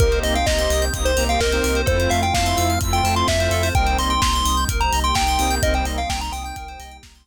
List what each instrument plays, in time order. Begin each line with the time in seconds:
0.00 synth bass 2 C2, lead 2 (sawtooth) A#3 C4 D#4 G4, pad 5 (bowed) A#3 C4 D#4 G4, electric piano 2 A#4, lead 1 (square) A#4, kick, closed hi-hat
0.12 electric piano 2 C5, closed hi-hat
0.23 synth bass 2 C2, lead 1 (square) D#5, electric piano 2 D#5, open hi-hat
0.35 lead 1 (square) F5, electric piano 2 G5, closed hi-hat
0.46 synth bass 2 C2, lead 1 (square) D#5, electric piano 2 A#5, kick, snare
0.58 lead 2 (sawtooth) A#3 C4 D#4 G4, electric piano 2 C6, closed hi-hat
0.70 synth bass 2 C2, electric piano 2 D#6, open hi-hat
0.82 electric piano 2 G6, closed hi-hat
0.93 synth bass 2 C2, lead 2 (sawtooth) A#3 C4 D#4 G4, pad 5 (bowed) A#3 C4 G4 A#4, electric piano 2 D#6, kick, closed hi-hat
1.05 lead 1 (square) C5, electric piano 2 C6, closed hi-hat
1.16 synth bass 2 C2, lead 2 (sawtooth) A#3 C4 D#4 G4, electric piano 2 A#5, open hi-hat
1.29 lead 1 (square) F5, electric piano 2 G5, closed hi-hat
1.40 synth bass 2 C2, lead 1 (square) A#4, electric piano 2 D#5, kick, snare
1.51 lead 2 (sawtooth) A#3 C4 D#4 G4, electric piano 2 C5, closed hi-hat
1.64 synth bass 2 C2, electric piano 2 A#4, open hi-hat
1.75 electric piano 2 C5, closed hi-hat
1.86 synth bass 2 F2, lead 2 (sawtooth) A3 C4 E4 F4, pad 5 (bowed) A3 C4 E4 F4, electric piano 2 A4, lead 1 (square) C5, kick, closed hi-hat
2.00 electric piano 2 C5, closed hi-hat
2.09 synth bass 2 F2, electric piano 2 E5, lead 1 (square) F5, open hi-hat
2.22 electric piano 2 F5, lead 1 (square) G5, closed hi-hat
2.34 synth bass 2 F2, lead 1 (square) F5, electric piano 2 A5, kick, snare
2.46 lead 2 (sawtooth) A3 C4 E4 F4, electric piano 2 C6, closed hi-hat
2.57 synth bass 2 F2, electric piano 2 E6, open hi-hat
2.69 electric piano 2 F6, closed hi-hat
2.81 synth bass 2 F2, pad 5 (bowed) A3 C4 F4 A4, lead 2 (sawtooth) A3 C4 E4 F4, electric piano 2 E6, kick, closed hi-hat
2.93 lead 1 (square) G5, electric piano 2 C6, closed hi-hat
3.03 synth bass 2 F2, lead 2 (sawtooth) A3 C4 E4 F4, electric piano 2 A5, open hi-hat
3.16 electric piano 2 F5, lead 1 (square) C6, closed hi-hat
3.28 synth bass 2 F2, lead 1 (square) E5, electric piano 2 E5, kick, snare
3.39 lead 2 (sawtooth) A3 C4 E4 F4, electric piano 2 C5, closed hi-hat
3.51 synth bass 2 F2, electric piano 2 A4, open hi-hat
3.63 electric piano 2 C5, open hi-hat
3.74 synth bass 2 C2, pad 5 (bowed) G3 A#3 C4 D#4, lead 2 (sawtooth) G3 A#3 C4 D#4, electric piano 2 A#4, lead 1 (square) G5, kick, closed hi-hat
3.86 electric piano 2 C5, closed hi-hat
3.98 synth bass 2 C2, electric piano 2 D#5, lead 1 (square) C6, open hi-hat
4.10 electric piano 2 G5, lead 1 (square) C6, closed hi-hat
4.22 synth bass 2 C2, electric piano 2 A#5, lead 1 (square) C6, kick, snare
4.33 electric piano 2 C6, closed hi-hat
4.45 synth bass 2 C2, electric piano 2 D#6, open hi-hat
4.57 electric piano 2 G6, closed hi-hat
4.68 synth bass 2 C2, pad 5 (bowed) G3 A#3 D#4 G4, electric piano 2 A#4, kick, closed hi-hat
4.80 electric piano 2 C5, lead 1 (square) A#5, closed hi-hat
4.92 synth bass 2 C2, electric piano 2 D#5, open hi-hat
5.04 electric piano 2 G5, lead 1 (square) C6, closed hi-hat
5.14 synth bass 2 C2, lead 1 (square) G5, electric piano 2 A#5, kick, snare
5.27 electric piano 2 C6, closed hi-hat
5.39 synth bass 2 C2, lead 2 (sawtooth) G3 A#3 C4 D#4, electric piano 2 D#6, open hi-hat
5.50 electric piano 2 G6, closed hi-hat
5.62 synth bass 2 C2, lead 2 (sawtooth) G3 A#3 C4 D#4, pad 5 (bowed) G3 A#3 C4 D#4, electric piano 2 A#4, lead 1 (square) D#5, kick, closed hi-hat
5.74 electric piano 2 C5, lead 1 (square) G5, closed hi-hat
5.85 synth bass 2 C2, electric piano 2 D#5, open hi-hat
5.97 lead 1 (square) F5, electric piano 2 G5, closed hi-hat
6.09 synth bass 2 C2, lead 1 (square) G5, electric piano 2 A#5, kick, snare
6.21 lead 1 (square) A#5, electric piano 2 C6, closed hi-hat
6.32 synth bass 2 C2, lead 1 (square) G5, electric piano 2 D#6, open hi-hat
6.44 lead 1 (square) G5, electric piano 2 G6, closed hi-hat
6.56 synth bass 2 C2, pad 5 (bowed) G3 A#3 D#4 G4, electric piano 2 A#4, kick, closed hi-hat
6.68 electric piano 2 C5, closed hi-hat
6.80 synth bass 2 C2, electric piano 2 D#5, open hi-hat
6.91 electric piano 2 G5, closed hi-hat
7.03 synth bass 2 C2, electric piano 2 A#5, kick, snare
7.15 electric piano 2 C6, closed hi-hat
7.25 synth bass 2 C2, electric piano 2 D#6